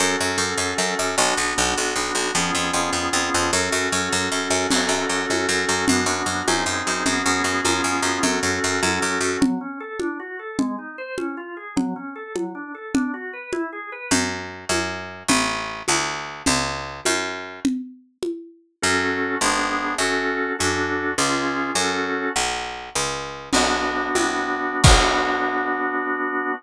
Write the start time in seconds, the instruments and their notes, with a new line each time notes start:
0.00 harpsichord F#2, drawbar organ C#4 F#4 A4
0.21 harpsichord F#2
0.38 harpsichord F#2
0.57 harpsichord F#2
0.78 harpsichord F#2
0.99 harpsichord F#2
1.18 harpsichord B1, drawbar organ B3 D4 F#4
1.37 harpsichord B1
1.58 harpsichord B1
1.77 harpsichord B1
1.96 harpsichord B1
2.15 harpsichord B1
2.35 harpsichord F2, drawbar organ B3 C#4 F4 G#4
2.55 harpsichord F2
2.73 harpsichord F2
2.93 harpsichord F2
3.13 harpsichord F2
3.34 harpsichord F2
3.53 harpsichord F#2, drawbar organ C#4 F#4 A4
3.72 harpsichord F#2
3.92 harpsichord F#2
4.13 harpsichord F#2
4.32 harpsichord F#2
4.50 harpsichord F#2
4.71 harpsichord F#2, drawbar organ C#4 F#4 A4, crash, low conga
4.89 harpsichord F#2
5.09 harpsichord F#2
5.30 harpsichord F#2, high conga
5.49 harpsichord F#2
5.69 harpsichord F#2
5.88 harpsichord F#2, drawbar organ B3 D4 F#4, low conga
6.06 harpsichord F#2
6.26 harpsichord F#2
6.47 harpsichord F#2, drawbar organ C4 D#4 G#4, high conga
6.66 harpsichord F#2
6.87 harpsichord F#2
7.06 harpsichord F#2, drawbar organ B3 C#4 F#4 G#4, low conga
7.26 harpsichord F#2
7.44 harpsichord F#2
7.65 harpsichord F#2, drawbar organ B3 C#4 F4 G#4, high conga
7.84 harpsichord F#2
8.02 harpsichord F#2
8.23 harpsichord F#2, drawbar organ C#4 F#4 A4, low conga
8.43 harpsichord F#2
8.64 harpsichord F#2
8.83 harpsichord F#2, high conga
9.02 harpsichord F#2
9.21 harpsichord F#2
9.41 drawbar organ F#3, low conga
9.61 drawbar organ C#4
9.80 drawbar organ A4
10.00 drawbar organ D4, high conga
10.20 drawbar organ F#4
10.39 drawbar organ A4
10.59 drawbar organ G#3, low conga
10.78 drawbar organ D#4
10.98 drawbar organ C5
11.18 drawbar organ C#4, high conga
11.37 drawbar organ F4
11.57 drawbar organ G#4
11.76 drawbar organ F#3, low conga
11.96 drawbar organ C#4
12.16 drawbar organ A4
12.35 drawbar organ F#3, high conga
12.55 drawbar organ D4
12.75 drawbar organ A4
12.94 drawbar organ D4, low conga
13.14 drawbar organ F#4
13.33 drawbar organ B4
13.53 drawbar organ E4, high conga
13.73 drawbar organ G#4
13.92 drawbar organ B4
14.11 harpsichord F#2, low conga
14.69 harpsichord F#2, high conga
15.28 harpsichord A1, low conga
15.88 harpsichord D2, high conga
16.46 harpsichord C#2, low conga
17.05 harpsichord F#2, high conga
17.65 low conga
18.23 high conga
18.82 harpsichord F#2, drawbar organ C#4 F#4 A4
19.41 harpsichord G#1, drawbar organ B3 D4 G#4
19.98 harpsichord F#2, drawbar organ C#4 F#4 A4
20.59 harpsichord F#2, drawbar organ D4 F#4 A4
21.18 harpsichord C#2, drawbar organ C#4 F4 G#4
21.75 harpsichord F#2, drawbar organ C#4 F#4 A4
22.36 harpsichord B1
22.95 harpsichord C#2
23.53 harpsichord B1, drawbar organ B3 D4 F#4, crash, low conga
24.15 harpsichord C2, high conga
24.84 harpsichord B1, drawbar organ B3 D4 F#4, kick, crash